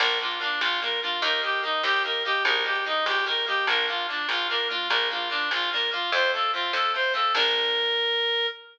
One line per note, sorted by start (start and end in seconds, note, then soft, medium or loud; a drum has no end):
0.00 0.55 A#1 loud
0.00 0.18 A#3 medium
0.00 0.18 D4 medium
0.00 0.18 F4 medium
0.00 0.19 A#4 medium
0.00 kick medium
0.00 crash loud
0.20 0.39 A#3 medium
0.20 0.40 D4 medium
0.20 0.39 F4 medium
0.20 0.40 F4 medium
0.31 closed hi-hat medium
0.40 0.77 A#3 medium
0.40 0.60 D4 medium
0.40 0.77 D4 medium
0.40 0.77 F4 medium
0.61 1.16 A#1 medium
0.61 0.80 F4 medium
0.61 snare medium
0.82 1.00 A#3 medium
0.82 1.00 D4 medium
0.82 1.00 F4 medium
0.82 1.00 A#4 medium
0.92 closed hi-hat medium
1.02 1.22 A#3 medium
1.02 1.22 D4 medium
1.02 1.21 F4 medium
1.02 1.22 F4 medium
1.22 1.77 D#2 loud
1.22 1.41 A#3 medium
1.22 1.42 D#4 medium
1.22 1.42 G4 medium
1.22 1.41 A#4 medium
1.22 kick medium
1.22 closed hi-hat loud
1.42 1.60 A#3 medium
1.42 1.60 D#4 medium
1.42 1.62 G4 medium
1.42 1.60 G4 medium
1.53 closed hi-hat medium
1.62 2.00 A#3 medium
1.62 1.82 D#4 medium
1.62 2.00 D#4 medium
1.62 2.00 G4 medium
1.83 2.39 D#2 medium
1.83 2.03 G4 medium
1.83 snare medium
2.04 2.23 A#3 medium
2.04 2.23 D#4 medium
2.04 2.23 G4 medium
2.04 2.23 A#4 medium
2.14 closed hi-hat medium
2.24 2.44 A#3 medium
2.24 2.44 D#4 medium
2.24 2.43 G4 medium
2.24 2.44 G4 medium
2.45 3.00 A#1 loud
2.45 2.63 A#3 medium
2.45 2.64 D#4 medium
2.45 2.64 G4 medium
2.45 2.64 A#4 medium
2.45 kick medium
2.45 closed hi-hat medium
2.64 2.82 A#3 medium
2.64 2.82 D#4 medium
2.64 2.84 G4 medium
2.64 2.82 G4 medium
2.75 closed hi-hat medium
2.85 3.23 A#3 medium
2.85 3.05 D#4 medium
2.85 3.23 D#4 medium
2.85 3.23 G4 medium
3.06 3.61 A#1 medium
3.06 3.25 G4 medium
3.06 snare medium
3.26 3.45 A#3 medium
3.26 3.45 D#4 medium
3.26 3.45 G4 medium
3.26 3.45 A#4 medium
3.37 closed hi-hat medium
3.47 3.65 A#3 medium
3.47 3.65 D#4 medium
3.47 3.66 G4 medium
3.47 3.65 G4 medium
3.67 4.22 A#1 loud
3.67 3.87 A#3 medium
3.67 3.87 D4 medium
3.67 3.87 F4 medium
3.67 3.86 A#4 medium
3.67 kick medium
3.67 closed hi-hat medium
3.88 4.06 A#3 medium
3.88 4.06 D4 medium
3.88 4.07 F4 medium
3.88 4.06 F4 medium
3.98 closed hi-hat medium
4.08 4.46 A#3 medium
4.08 4.27 D4 medium
4.08 4.46 D4 medium
4.08 4.46 F4 medium
4.29 4.84 A#1 medium
4.29 4.47 F4 medium
4.29 snare medium
4.49 4.69 A#3 medium
4.49 4.69 D4 medium
4.49 4.69 F4 medium
4.49 4.68 A#4 medium
4.59 closed hi-hat medium
4.69 4.88 A#3 medium
4.69 4.88 D4 medium
4.69 4.88 F4 medium
4.90 5.45 A#1 loud
4.90 5.09 A#3 medium
4.90 5.09 D4 medium
4.90 5.09 F4 medium
4.90 5.09 A#4 medium
4.90 kick medium
4.90 closed hi-hat medium
5.10 5.29 A#3 medium
5.10 5.29 D4 medium
5.10 5.29 F4 medium
5.21 closed hi-hat medium
5.30 5.67 A#3 medium
5.30 5.49 D4 medium
5.30 5.67 D4 medium
5.30 5.67 F4 medium
5.51 6.06 A#1 medium
5.51 5.70 F4 medium
5.51 snare medium
5.71 5.91 A#3 medium
5.71 5.92 D4 medium
5.71 5.92 F4 medium
5.71 5.90 A#4 medium
5.81 closed hi-hat medium
5.91 6.10 A#3 medium
5.91 6.10 D4 medium
5.91 6.11 F4 medium
5.91 6.10 F4 medium
6.12 6.67 F2 loud
6.12 6.33 A3 medium
6.12 6.33 C4 medium
6.12 6.33 F4 medium
6.12 6.31 C5 medium
6.12 kick medium
6.12 closed hi-hat medium
6.33 6.53 A3 medium
6.33 6.53 C4 medium
6.33 6.53 F4 medium
6.33 6.51 A4 medium
6.43 closed hi-hat medium
6.53 6.91 A3 medium
6.53 6.91 C4 medium
6.53 6.72 F4 medium
6.53 6.91 F4 medium
6.73 7.28 F2 medium
6.73 6.92 A4 medium
6.73 snare medium
6.94 7.13 A3 medium
6.94 7.13 C4 medium
6.94 7.13 F4 medium
6.94 7.13 C5 medium
7.04 closed hi-hat medium
7.14 7.32 A3 medium
7.14 7.32 C4 medium
7.14 7.32 F4 medium
7.14 7.33 A4 medium
7.35 8.46 A#1 loud
7.35 8.47 A#3 loud
7.35 8.47 D4 loud
7.35 8.47 F4 loud
7.35 8.47 A#4 loud
7.35 kick loud
7.35 crash loud